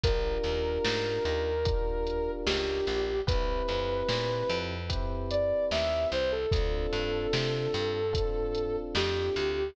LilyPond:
<<
  \new Staff \with { instrumentName = "Ocarina" } { \time 4/4 \key d \minor \tempo 4 = 74 bes'2. g'4 | b'2 r8 d''8 e''8 c''16 a'16 | a'2. g'4 | }
  \new Staff \with { instrumentName = "Electric Piano 1" } { \time 4/4 \key d \minor <d' f' g' bes'>2 <d' f' g' bes'>2 | <c' e' g' b'>2 <c' e' g' b'>2 | <c' d' f' a'>2 <c' d' f' a'>2 | }
  \new Staff \with { instrumentName = "Electric Bass (finger)" } { \clef bass \time 4/4 \key d \minor bes,,8 ees,8 aes,8 ees,4. cis,8 bes,,8 | c,8 f,8 bes,8 f,4. ees,8 c,8 | d,8 g,8 c8 g,4. f,8 d,8 | }
  \new DrumStaff \with { instrumentName = "Drums" } \drummode { \time 4/4 <hh bd>8 <hh sn>8 sn8 hh8 <hh bd>8 hh8 sn8 hh8 | <hh bd>8 <hh sn>8 sn8 hh8 <hh bd>8 hh8 sn8 hh8 | <hh bd>8 <hh sn>8 sn8 hh8 <hh bd>8 hh8 sn8 hh8 | }
>>